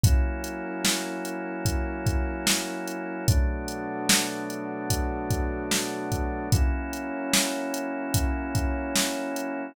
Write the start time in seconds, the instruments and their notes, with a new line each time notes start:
0.04 drawbar organ F#3 A#3 C#4 E4, pad 5 (bowed) F#3 C#4 E4 A#4, kick, closed hi-hat
0.44 closed hi-hat
0.85 snare
1.25 closed hi-hat
1.65 kick, closed hi-hat
2.06 kick, closed hi-hat
2.47 snare
2.88 closed hi-hat
3.28 drawbar organ B2 F#3 A3 D4, pad 5 (bowed) B3 D4 F#4 A4, kick, closed hi-hat
3.68 closed hi-hat
4.09 snare
4.50 closed hi-hat
4.90 kick, closed hi-hat
5.31 kick, closed hi-hat
5.71 snare
6.12 kick, closed hi-hat
6.52 drawbar organ F#3 A#3 C#4 E4, pad 5 (bowed) F#3 C#4 E4 A#4, kick, closed hi-hat
6.93 closed hi-hat
7.34 snare
7.74 closed hi-hat
8.14 kick, closed hi-hat
8.55 kick, closed hi-hat
8.96 snare
9.36 closed hi-hat